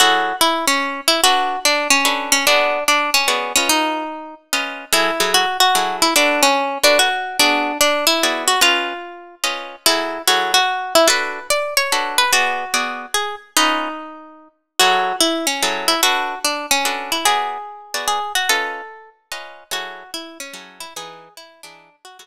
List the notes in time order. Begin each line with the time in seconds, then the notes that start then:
0.00 F#3 E4 F#4 G#4 A4
0.41 E4
0.67 C#4
1.08 E4
1.24 D4 F#4 A4 B4
1.65 D4
1.90 C#4
2.05 D4 F#4 A4 B4
2.32 C#4
2.47 B3 D4 F#4 G#4 D5
2.88 D4
3.14 C#4
3.28 B3 F#4 G#4 D5
3.56 C#4 F4 B4 D#5
3.69 D#4
4.53 C#4 F4 B4 D#5
4.93 F#3 E4 G#4 A4
5.20 F#3 E4 G#4 A4
5.34 F#4
5.60 F#4
5.75 F#3 E4 G#4 A4
6.02 E4
6.16 D4 F#4 A4 B4
6.43 C#4
6.83 D4 F#4 A4 B4
6.99 F#4
7.39 B3 D4 F#4 G#4 D5
7.81 D4
8.07 E4
8.23 B3 F#4 G#4 D5
8.48 F#4
8.61 C#4 F4 B4 D#5
9.44 C#4 F4 B4 D#5
9.86 F#3 E4 G#4 A4
10.27 F#3 E4 F#4 G#4 A4
10.54 F#4
10.95 E4
11.08 D4 F#4 A4 B4
11.50 D5
11.77 C#5
11.92 D4 F#4 A4 B4
12.18 B4
12.33 B3 F#4 G#4 D5
12.74 B3 F#4 G#4 D5
13.14 G#4
13.57 C#4 D#4 F4 B4 D#5
14.79 F#3 E4 F#4 G#4 A4
15.20 E4
15.47 C#4
15.63 F#3 E4 G#4 A4
15.88 E4
16.03 D4 F#4 A4 B4
16.45 D4
16.71 C#4
16.85 D4 F#4 A4 B4
17.12 E4
17.25 B3 F#4 G#4 D5
17.94 B3 F#4 G#4 D5
18.08 G#4
18.35 F#4
18.49 C#4 F4 A4 B4 D#5
19.32 C#4 F4 B4 D#5
19.71 F#3 E4 F#4 G#4 A4
20.14 E4
20.40 C#4
20.54 F#3 E4 G#4 A4
20.80 E4
20.96 E3 D#4 G#4 B4
21.37 E4
21.63 E3 D4 D#4 G#4 B4
22.05 F#4
22.19 F#3 E4 F#4 G#4 A4